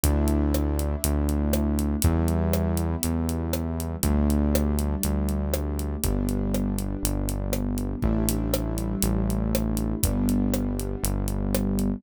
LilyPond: <<
  \new Staff \with { instrumentName = "Acoustic Grand Piano" } { \time 4/4 \key d \major \tempo 4 = 120 <a d' e'>1 | <g b e'>1 | <g a d'>1 | <g b d'>1 |
<g a d' e'>1 | <g b d'>1 | }
  \new Staff \with { instrumentName = "Synth Bass 1" } { \clef bass \time 4/4 \key d \major d,2 d,2 | e,2 e,2 | d,2 d,2 | g,,2 g,,2 |
a,,2 a,,2 | g,,2 g,,2 | }
  \new DrumStaff \with { instrumentName = "Drums" } \drummode { \time 4/4 <hh bd>8 hh8 ss8 hh8 hh8 hh8 ss8 hh8 | <hh bd>8 hh8 ss8 hh8 hh8 hh8 ss8 hh8 | <hh bd>8 hh8 ss8 hh8 hh8 hh8 ss8 hh8 | <hh bd>8 hh8 ss8 hh8 hh8 hh8 ss8 hh8 |
bd8 hh8 ss8 hh8 hh8 hh8 ss8 hh8 | <hh bd>8 hh8 ss8 hh8 hh8 hh8 ss8 hh8 | }
>>